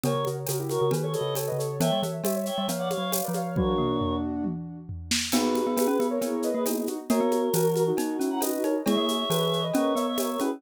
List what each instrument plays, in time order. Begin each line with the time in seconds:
0.03 glockenspiel C#3, ocarina A#4 C#5, choir aahs A#4 C#5, cowbell, low conga, shaker
0.15 glockenspiel C#3
0.25 glockenspiel C#3, ocarina F#4 A#4, high conga, shaker
0.47 glockenspiel C#3, ocarina F#4 A#4, tambourine, cowbell, high conga, shaker
0.59 ocarina E4 G4
0.69 ocarina F#4 A#4, choir aahs A#4 C#5, high conga, shaker
0.81 glockenspiel C#3, ocarina F#4 A#4
0.91 glockenspiel D#3, ocarina G4 B4, cowbell, low conga, shaker
1.02 choir aahs A4 C#5, ocarina A4 C#5
1.13 ocarina A4 C#5, choir aahs B4 D#5, high conga, shaker
1.21 glockenspiel C#3
1.35 ocarina A4 C#5, tambourine, cowbell, high conga, shaker
1.47 ocarina B4 D#5
1.52 glockenspiel C#3
1.58 ocarina A4 C#5, shaker
1.80 glockenspiel E3, ocarina C#5 E5, choir aahs E5 G5, cowbell, low conga, shaker
1.92 glockenspiel G3
2.02 glockenspiel E3, ocarina C#5 E5, high conga, shaker
2.24 glockenspiel G3, ocarina C#5 E5, tambourine, cowbell, high conga, shaker
2.35 ocarina C#5 E5
2.46 ocarina C#5 E5, choir aahs E5 G5, shaker
2.58 glockenspiel G3, ocarina C#5 E5
2.68 glockenspiel F3, ocarina C#5 F5, cowbell, low conga, shaker
2.78 ocarina C#5 F5, choir aahs D5 F#5
2.90 ocarina C#5 F5, choir aahs C#5 F5, high conga, shaker
2.98 glockenspiel F#3
3.12 ocarina C#5 F5, tambourine, cowbell, high conga, shaker
3.24 ocarina B4 D5
3.28 glockenspiel F3
3.34 ocarina C#5 F5, high conga, shaker
3.56 glockenspiel F#3, ocarina D4 F#4, choir aahs A#4 C#5, kick, high tom
3.78 glockenspiel A#3, mid tom
4.01 floor tom
4.44 high tom
4.89 floor tom
5.11 snare
5.32 glockenspiel B3, ocarina D#4 F#4, choir aahs G#4 B4, crash, cowbell, low conga, shaker
5.55 high conga, shaker
5.67 glockenspiel B3
5.77 glockenspiel B3, ocarina G#4 B4, tambourine, cowbell, high conga, shaker
5.87 glockenspiel C#4
6.00 glockenspiel B3, high conga, shaker
6.10 ocarina A#4 C#5
6.21 glockenspiel B3, choir aahs E4 G#4, cowbell, low conga, shaker
6.42 ocarina B4 D#5, shaker
6.53 glockenspiel A#3, choir aahs G#4 B4
6.65 ocarina B3 D#4, choir aahs E4 G#4, tambourine, cowbell, high conga, shaker
6.76 choir aahs E4 G#4
6.87 choir aahs D#4 F#4, ocarina D#4 F#4, high conga, shaker
7.09 glockenspiel A#3, choir aahs F#4 A#4, ocarina A#4 C#5, cowbell, low conga, shaker
7.20 glockenspiel B3
7.32 high conga, shaker
7.53 glockenspiel E3, ocarina F#4 A#4, tambourine, cowbell, high conga, shaker
7.76 high conga, shaker
7.87 ocarina D#4 F#4
7.97 choir aahs D#4 F#4, glockenspiel D#4, cowbell, low conga, shaker
8.19 glockenspiel C#4, ocarina C#4 E4, shaker
8.30 choir aahs F#5 A#5
8.41 choir aahs D#4 F#4, ocarina B4 D#5, tambourine, cowbell, high conga, shaker
8.52 choir aahs D#4 F#4
8.64 choir aahs D#4 F#4, glockenspiel D#4, ocarina A#4 C#5, high conga, shaker
8.86 glockenspiel G#3, ocarina E4 G#4, choir aahs C#5 E5, cowbell, low conga, shaker
8.97 glockenspiel A#3
9.09 high conga, shaker
9.30 glockenspiel E3, ocarina G#4 B4, tambourine, cowbell, high conga, shaker
9.53 shaker
9.63 ocarina B4 D#5
9.74 glockenspiel C#4, choir aahs A#4 C#5, cowbell, low conga, shaker
9.95 glockenspiel B3, ocarina C#5 E5, shaker
10.06 choir aahs C#5 E5
10.18 choir aahs A#4 C#5, ocarina C#5 E5, tambourine, cowbell, high conga, shaker
10.30 choir aahs A#4 C#5
10.40 glockenspiel C#4, ocarina E4 G#4, choir aahs G#4 B4, high conga, shaker